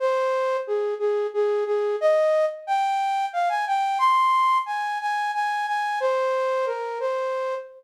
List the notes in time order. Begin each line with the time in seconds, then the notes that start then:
0.00 C5
0.67 G#4
0.99 G#4
1.34 G#4
1.66 G#4
2.01 D#5
2.67 G5
3.33 F5
3.49 G#5
3.67 G5
3.99 C6
4.66 G#5
5.01 G#5
5.34 G#5
5.67 G#5
6.00 C5
6.66 A#4
7.00 C5